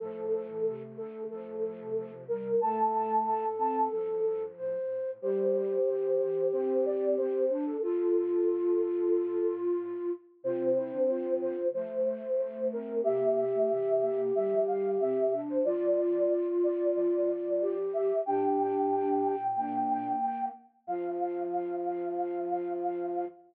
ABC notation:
X:1
M:4/4
L:1/16
Q:1/4=92
K:F
V:1 name="Flute"
A6 A2 A6 B2 | a6 a2 A4 z4 | c8 c2 d2 c3 A | A12 z4 |
c6 c2 c6 B2 | e8 e2 f2 e3 c | d6 d2 d6 e2 | g14 z2 |
f16 |]
V:2 name="Flute"
A,16 | A4 A8 c4 | G16 | F10 z6 |
F2 E D F4 A,6 C2 | G16 | F16 | G8 D4 z4 |
F16 |]
V:3 name="Flute"
F,3 E, C,2 D,2 F,4 F,2 G,2 | A,6 C2 F,6 z2 | G,4 E,2 E,2 C4 C2 D2 | F16 |
C8 A,8 | B,3 A, E,2 B,2 G,4 C2 D2 | F12 G4 | D8 B,6 z2 |
F,16 |]
V:4 name="Flute" clef=bass
A,,4 z4 F,, A,, A,, C, C,4 | A,,4 A,,4 G,, E,, G,,2 A,,4 | E,,8 G,,6 E,,2 | F,,2 G,,6 A,,6 z2 |
C,3 D,3 D,2 F,2 z2 F,,2 E,,2 | C,4 C,4 D, F, D,2 C,4 | F,4 z4 F,8 | B,,12 z4 |
F,,16 |]